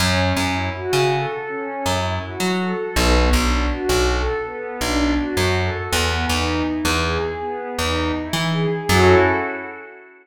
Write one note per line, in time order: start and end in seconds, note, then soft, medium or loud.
0.00 0.33 F#2 loud
0.00 0.32 C#4 loud
0.37 0.70 F#2 medium
0.37 0.71 E4 medium
0.75 1.08 F#4 medium
0.93 1.26 C#3 medium
1.12 1.45 A4 medium
1.48 1.82 C#4 medium
1.84 2.19 F#2 medium
1.84 2.18 E4 medium
2.23 2.56 F#4 medium
2.40 2.73 F#3 medium
2.60 2.94 A4 medium
2.96 3.29 B1 loud
2.96 3.29 B3 medium
3.33 3.66 B1 medium
3.33 3.67 D4 medium
3.70 4.03 F#4 medium
3.89 4.23 B1 medium
4.07 4.40 A4 medium
4.45 4.79 B3 medium
4.81 5.14 B1 medium
4.81 5.15 D4 medium
5.17 5.51 F#4 medium
5.37 5.70 F#2 medium
5.55 5.89 A4 medium
5.92 6.26 E2 loud
5.92 6.25 B3 medium
6.29 6.63 E2 medium
6.29 6.62 D#4 medium
6.66 7.00 E4 soft
6.85 7.18 E2 loud
7.04 7.37 G#4 medium
7.41 7.74 B3 medium
7.78 8.12 E2 medium
7.78 8.11 D#4 medium
8.15 8.48 E4 medium
8.33 8.67 E3 medium
8.51 8.85 G#4 medium
8.89 9.15 F#2 loud
8.89 9.15 C#4 medium
8.89 9.15 E4 loud
8.89 9.15 F#4 loud
8.89 9.15 A4 loud